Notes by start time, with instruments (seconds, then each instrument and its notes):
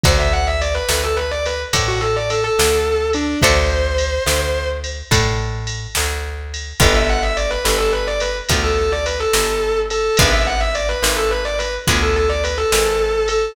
0.04 electric bass (finger) D2, acoustic guitar (steel) A4 C5 D5 F#5, distortion guitar C5, kick, ride
0.19 distortion guitar E5
0.33 distortion guitar F#5
0.47 distortion guitar E5
0.61 distortion guitar D5, ride
0.74 distortion guitar B4
0.89 electric bass (finger) D2, distortion guitar B4, snare
1.03 distortion guitar A4
1.16 distortion guitar B4
1.31 distortion guitar D5
1.46 distortion guitar B4, ride
1.73 electric bass (finger) A2, acoustic guitar (steel) A4 C5 D5 F#5, kick, ride
1.88 distortion guitar F#4
2.01 distortion guitar A4
2.16 distortion guitar D5
2.30 distortion guitar A4, ride
2.44 distortion guitar A4
2.59 electric bass (finger) D2, snare
3.13 distortion guitar D4, ride
3.42 electric bass (finger) D2, acoustic guitar (steel) A4 C5 D5 F#5, distortion guitar C5, kick, ride
3.98 ride
4.26 electric bass (finger) D2, snare
4.84 ride
5.11 electric bass (finger) A2, acoustic guitar (steel) A4 C5 D5 F#5, kick, ride
5.67 ride
5.95 electric bass (finger) D2, snare
6.54 ride
6.80 electric bass (finger) G1, acoustic guitar (steel) B3 D4 F4 G4, distortion guitar B4, kick, ride
6.95 distortion guitar E5
7.09 distortion guitar F#5
7.23 distortion guitar E5
7.37 distortion guitar D5, ride
7.51 distortion guitar B4
7.65 electric bass (finger) G1, distortion guitar B4, snare
7.78 distortion guitar A4
7.92 distortion guitar B4
8.07 distortion guitar D5
8.20 distortion guitar B4, ride
8.49 electric bass (finger) D2, acoustic guitar (steel) B3 D4 F4 G4, kick, ride
8.63 distortion guitar A4
8.78 distortion guitar A4
8.92 distortion guitar D5
9.06 distortion guitar B4, ride
9.20 distortion guitar A4
9.33 electric bass (finger) G1, snare
9.90 distortion guitar A4, ride
10.17 electric bass (finger) G#1, acoustic guitar (steel) B3 D4 F4 G#4, distortion guitar B4, kick, ride
10.32 distortion guitar E5
10.47 distortion guitar F#5
10.60 distortion guitar E5
10.75 distortion guitar D5, ride
10.89 distortion guitar B4
11.02 electric bass (finger) G#1, distortion guitar B4, snare
11.16 distortion guitar A4
11.31 distortion guitar B4
11.45 distortion guitar D5
11.59 distortion guitar B4, ride
11.87 electric bass (finger) D2, acoustic guitar (steel) B3 D4 F4 G#4, kick, ride
12.02 distortion guitar A4
12.16 distortion guitar A4
12.29 distortion guitar D5
12.44 distortion guitar B4, ride
12.58 distortion guitar A4
12.72 electric bass (finger) G#1, snare
13.28 distortion guitar A4, ride